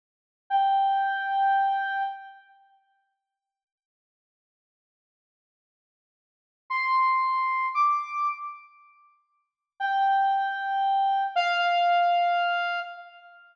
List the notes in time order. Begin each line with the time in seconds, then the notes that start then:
0.50 G5
6.70 C6
7.74 D6
9.80 G5
11.36 F5